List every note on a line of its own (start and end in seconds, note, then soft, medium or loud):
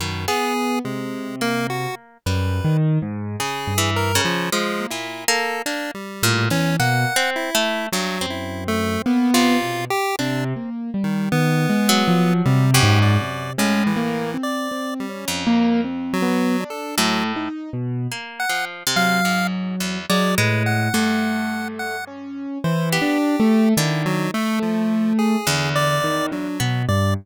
0.00 0.26 F#2 medium
0.00 0.26 B2 medium
0.00 0.26 D#3 medium
0.28 0.53 B3 medium
0.28 0.79 B3 medium
0.28 0.79 G#4 loud
0.85 1.87 C3 medium
0.85 1.36 G#3 medium
1.41 2.17 A#3 medium
1.41 1.67 A#3 loud
1.70 1.95 F#4 medium
2.26 2.60 F#2 medium
2.26 2.78 G3 medium
2.26 2.77 B4 medium
2.64 2.98 D#3 medium
3.02 3.36 G#2 medium
3.40 3.74 C#3 medium
3.40 3.91 G#4 medium
3.67 4.18 G2 medium
3.78 4.12 E3 medium
3.96 4.22 A#4 medium
4.15 4.49 C#3 loud
4.25 4.50 F3 loud
4.52 4.86 F3 medium
4.52 4.87 G#3 medium
4.81 5.06 A#3 medium
4.90 5.25 A#2 medium
4.90 5.24 E4 medium
5.28 5.62 A#3 loud
5.28 5.62 A4 medium
5.66 5.92 A#3 medium
5.66 5.91 D4 medium
5.95 6.46 G3 medium
6.23 6.48 A2 medium
6.23 6.49 A#2 loud
6.50 6.76 E2 medium
6.50 6.76 E3 medium
6.50 6.77 C#4 loud
6.79 7.05 B2 medium
6.79 7.13 A#3 medium
6.79 7.30 F#5 loud
7.16 7.50 C4 loud
7.36 7.87 E4 medium
7.55 7.89 A3 loud
7.92 8.18 G2 medium
7.92 8.26 F#3 medium
8.21 8.97 F#2 medium
8.21 9.23 C4 medium
8.30 8.64 E4 medium
8.68 9.02 A3 loud
9.06 9.31 A#3 soft
9.06 9.57 B3 loud
9.34 9.85 C3 medium
9.34 9.85 F4 loud
9.62 9.88 B2 medium
9.90 10.16 G4 loud
10.19 10.53 C3 loud
10.19 10.70 C4 medium
10.19 10.44 D4 medium
10.56 10.90 A#3 medium
10.94 11.28 G3 medium
11.04 11.29 D#3 medium
11.32 11.66 D#3 medium
11.32 12.34 B3 loud
11.69 12.03 G#3 medium
11.89 12.65 F#3 loud
12.08 12.42 F3 medium
12.45 12.80 C3 loud
12.45 12.71 G3 medium
12.74 13.51 F#2 loud
12.74 12.99 G4 medium
12.83 13.17 G#2 loud
13.02 13.53 D5 medium
13.21 13.55 C3 medium
13.58 14.35 A2 medium
13.58 13.92 G#3 medium
13.58 13.84 C#4 medium
13.87 14.37 E3 medium
13.96 14.30 A#3 loud
14.34 14.68 C4 medium
14.43 14.94 D5 medium
14.71 15.05 C4 medium
15.00 15.25 G3 medium
15.09 15.43 C#4 medium
15.28 16.30 F2 medium
15.47 15.81 A#3 loud
15.84 16.18 C4 medium
16.13 16.64 F#3 loud
16.22 16.56 B3 medium
16.60 16.94 D4 medium
16.70 16.96 A4 medium
16.98 17.49 A2 loud
16.98 17.24 F#3 medium
16.98 17.32 A3 medium
17.36 17.70 D#4 medium
17.73 18.07 B2 medium
18.12 18.46 A#3 medium
18.40 18.65 F#5 medium
18.49 18.83 F3 medium
18.87 19.21 C3 medium
18.96 19.98 F#3 medium
18.96 19.47 F5 loud
19.25 19.76 G#2 medium
19.80 20.06 E2 medium
20.09 20.35 F#3 medium
20.09 20.35 G#3 medium
20.09 20.35 D5 loud
20.38 20.89 A2 medium
20.38 20.89 G#3 loud
20.38 20.63 B4 medium
20.66 21.68 F#5 medium
20.94 22.47 G2 medium
20.94 21.96 A3 medium
21.79 22.05 F#5 medium
22.07 22.58 C#4 medium
22.64 22.98 E3 loud
22.64 22.90 C5 medium
22.92 23.18 B3 medium
22.92 23.69 G4 medium
23.02 23.36 D4 medium
23.40 23.74 A3 loud
23.77 24.28 D3 medium
23.77 24.28 D#3 medium
23.77 24.03 E4 medium
24.06 24.31 F#3 loud
24.34 24.59 A3 loud
24.34 25.36 A3 loud
24.62 25.13 F3 medium
25.19 25.70 G#4 medium
25.47 26.49 E2 medium
25.47 25.98 D3 medium
25.75 26.26 D5 loud
26.04 26.29 D#3 medium
26.32 26.83 F#3 medium
26.32 26.57 D4 medium
26.60 26.86 B2 medium
26.60 26.85 B3 medium
26.88 27.14 G2 medium
26.88 27.14 D5 medium